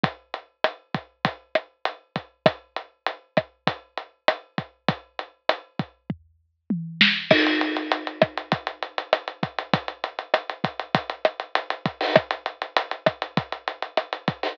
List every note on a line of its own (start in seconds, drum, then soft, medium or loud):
0.04 kick medium
0.04 closed hi-hat medium
0.34 closed hi-hat medium
0.64 cross-stick medium
0.64 closed hi-hat medium
0.94 kick medium
0.94 closed hi-hat medium
1.25 kick medium
1.25 closed hi-hat medium
1.55 cross-stick medium
1.55 closed hi-hat medium
1.85 closed hi-hat medium
2.16 kick medium
2.16 closed hi-hat medium
2.46 kick medium
2.46 cross-stick medium
2.46 closed hi-hat medium
2.76 closed hi-hat medium
3.06 closed hi-hat medium
3.37 kick medium
3.37 cross-stick medium
3.37 closed hi-hat medium
3.67 kick medium
3.67 closed hi-hat medium
3.97 closed hi-hat medium
4.28 cross-stick medium
4.28 closed hi-hat loud
4.58 kick medium
4.58 closed hi-hat medium
4.88 kick medium
4.88 closed hi-hat medium
5.19 closed hi-hat medium
5.49 cross-stick medium
5.49 closed hi-hat loud
5.79 kick medium
5.79 closed hi-hat medium
6.10 kick medium
6.10 floor tom medium
6.70 high tom medium
7.01 snare loud
7.31 kick medium
7.31 cross-stick loud
7.31 crash loud
7.46 closed hi-hat medium
7.61 closed hi-hat medium
7.77 closed hi-hat medium
7.92 closed hi-hat medium
8.07 closed hi-hat medium
8.22 kick medium
8.22 cross-stick medium
8.22 closed hi-hat medium
8.37 closed hi-hat medium
8.52 kick medium
8.52 closed hi-hat medium
8.67 closed hi-hat medium
8.82 closed hi-hat medium
8.98 closed hi-hat medium
9.13 cross-stick medium
9.13 closed hi-hat medium
9.28 closed hi-hat medium
9.43 kick medium
9.43 closed hi-hat medium
9.58 closed hi-hat medium
9.73 kick medium
9.73 closed hi-hat loud
9.88 closed hi-hat medium
10.04 closed hi-hat medium
10.19 closed hi-hat medium
10.34 cross-stick medium
10.34 closed hi-hat medium
10.49 closed hi-hat medium
10.64 kick medium
10.64 closed hi-hat medium
10.79 closed hi-hat medium
10.95 kick medium
10.95 closed hi-hat loud
11.10 closed hi-hat medium
11.25 cross-stick medium
11.25 closed hi-hat medium
11.40 closed hi-hat medium
11.55 closed hi-hat medium
11.70 closed hi-hat medium
11.85 kick medium
11.85 closed hi-hat medium
12.01 open hi-hat medium
12.16 kick medium
12.16 cross-stick loud
12.16 closed hi-hat medium
12.31 closed hi-hat medium
12.46 closed hi-hat medium
12.62 closed hi-hat medium
12.77 closed hi-hat loud
12.91 closed hi-hat medium
13.06 kick medium
13.06 cross-stick medium
13.06 closed hi-hat medium
13.22 closed hi-hat medium
13.37 kick medium
13.37 closed hi-hat medium
13.52 closed hi-hat medium
13.68 closed hi-hat medium
13.82 closed hi-hat medium
13.97 cross-stick medium
13.97 closed hi-hat medium
14.13 closed hi-hat medium
14.28 kick medium
14.28 closed hi-hat medium
14.43 open hi-hat medium